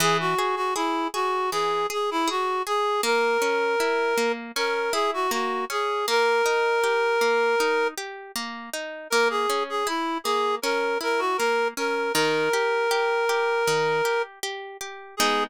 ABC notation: X:1
M:4/4
L:1/16
Q:1/4=79
K:G#m
V:1 name="Clarinet"
G F2 F E2 F2 G2 G E F2 G2 | A8 A2 G F F2 G2 | A10 z6 | A G2 G E2 G2 A2 A F A2 A2 |
A12 z4 | G4 z12 |]
V:2 name="Orchestral Harp"
E,2 G2 G2 G2 E,2 G2 G2 G2 | A,2 C2 E2 A,2 C2 E2 A,2 C2 | A,2 D2 =G2 A,2 D2 G2 A,2 D2 | A,2 C2 E2 A,2 C2 E2 A,2 C2 |
D,2 =G2 G2 G2 D,2 G2 G2 G2 | [G,B,D]4 z12 |]